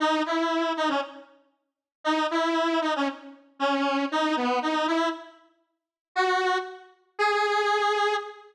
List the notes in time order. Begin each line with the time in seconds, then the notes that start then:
0.00 D#4
0.26 E4
0.77 D#4
0.88 C#4
2.04 D#4
2.31 E4
2.81 D#4
2.96 C#4
3.59 C#4
4.11 D#4
4.36 B3
4.62 D#4
4.87 E4
6.15 F#4
7.18 G#4